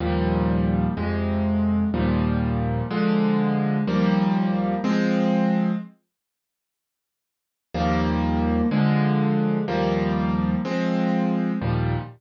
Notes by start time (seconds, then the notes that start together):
0.00 D#2 A#2 F3 G3
0.97 F2 C3 G#3
1.94 D#2 A#2 F3 G3
2.90 D3 F3 G#3
3.87 D#2 F3 G3 A#3
4.84 F3 G#3 C4
7.74 D#2 F3 G3 A#3
8.71 D3 F3 G#3
9.68 D#2 F3 G3 A#3
10.65 F3 G#3 C4
11.61 D#2 A#2 F3 G3